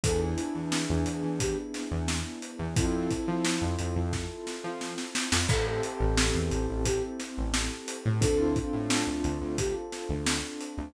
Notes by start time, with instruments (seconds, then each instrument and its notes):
0.03 synth bass 1 E2, acoustic grand piano B3 D4 E4 G#4, flute A4, kick, closed hi-hat
0.21 flute E4
0.38 closed hi-hat
0.55 synth bass 1 E2
0.72 snare
0.89 synth bass 1 E2
1.06 synth bass 1 E2, closed hi-hat
1.23 synth bass 1 E2
1.40 flute G4, kick, closed hi-hat
1.74 snare, closed hi-hat
1.91 synth bass 1 E2
2.08 snare
2.42 closed hi-hat
2.59 synth bass 1 E2
2.76 synth bass 1 F2, acoustic grand piano C4 E4 F4 A4, flute E4, kick, closed hi-hat
3.11 kick, closed hi-hat
3.27 synth bass 1 F3
3.45 snare
3.61 synth bass 1 F2
3.79 synth bass 1 F2, closed hi-hat
3.96 synth bass 1 F2
4.13 kick, snare
4.47 snare
4.64 synth bass 1 F3
4.81 snare
4.98 snare
5.15 snare
5.32 synth bass 1 F2, snare
5.49 synth bass 1 A1, acoustic grand piano C4 E4 G4 A4, flute A4, kick, crash
5.66 flute A4
5.83 closed hi-hat
6.00 synth bass 1 A1
6.17 snare
6.35 synth bass 1 E2
6.51 synth bass 1 A1, closed hi-hat
6.69 synth bass 1 A1
6.85 flute G4, kick, closed hi-hat
7.19 snare, closed hi-hat
7.37 synth bass 1 A1
7.54 snare
7.88 closed hi-hat
8.05 synth bass 1 A2
8.21 synth bass 1 D2, acoustic grand piano C4 D4 F4 A4, flute A4, kick, closed hi-hat
8.39 flute E4
8.56 kick, closed hi-hat
8.73 synth bass 1 A2
8.90 snare
9.07 synth bass 1 D2
9.24 synth bass 1 D2, closed hi-hat
9.41 synth bass 1 D2
9.58 flute G4, kick, closed hi-hat
9.92 snare, closed hi-hat
10.09 synth bass 1 D2
10.26 snare
10.61 closed hi-hat
10.78 synth bass 1 D2